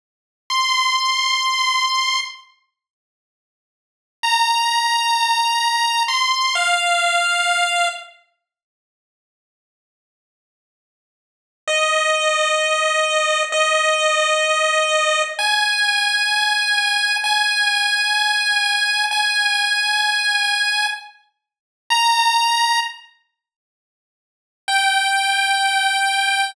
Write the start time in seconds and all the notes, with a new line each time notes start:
0.50 C6
4.23 A#5
6.08 C6
6.55 F5
11.68 D#5
13.52 D#5
15.39 G#5
17.24 G#5
19.11 G#5
21.90 A#5
24.68 G5